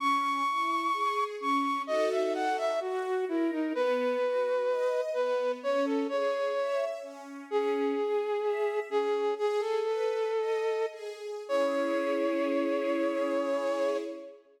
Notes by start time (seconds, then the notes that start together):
0.00 C#4 C#6
0.47 E4
0.93 G#4
1.40 C#4 C#6
1.87 D#4 F#4 A4 D#5
2.11 E5
2.35 F#5
2.57 E5
2.80 F#4
3.29 E4 A#4
3.51 D#4
3.75 B3 B4
4.22 F#4
4.68 D#5
5.14 B3 B4
5.62 C#4 C#5
5.85 A4
6.09 G#4 C#5
6.57 E5
7.02 C#4
7.50 C#4 G#4
7.98 G#4
8.43 E5
8.89 C#4 G#4
9.36 G#4
9.60 A4
9.84 B4
10.37 D#5
10.91 G#4
11.48 C#4 E4 G#4 C#5